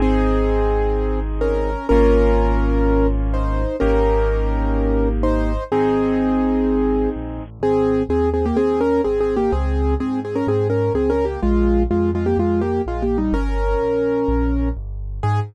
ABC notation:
X:1
M:4/4
L:1/16
Q:1/4=126
K:Ab
V:1 name="Acoustic Grand Piano"
[CA]12 [DB]4 | [DB]12 [Ec]4 | [DB]12 [Ec]4 | [CA]12 z4 |
[CA]4 [CA]2 [CA] [B,G] [CA]2 [DB]2 (3[CA]2 [CA]2 [B,G]2 | [CA]4 [CA]2 [CA] [DB] [CA]2 [DB]2 (3[CA]2 [DB]2 [B,G]2 | [A,F]4 [A,F]2 [A,F] [B,G] [A,F]2 [B,G]2 (3[A,F]2 [B,G]2 [G,E]2 | [DB]12 z4 |
A4 z12 |]
V:2 name="Acoustic Grand Piano"
[CEA]16 | [B,DF]16 | [B,EG]16 | [CEA]16 |
z16 | z16 | z16 | z16 |
z16 |]
V:3 name="Acoustic Grand Piano" clef=bass
A,,,16 | A,,,16 | A,,,16 | A,,,12 B,,,2 =A,,,2 |
A,,,4 E,,4 E,,4 A,,,4 | D,,4 A,,4 A,,4 D,,4 | B,,,4 F,,4 F,,4 B,,,4 | G,,,4 B,,,4 B,,,4 G,,,4 |
A,,4 z12 |]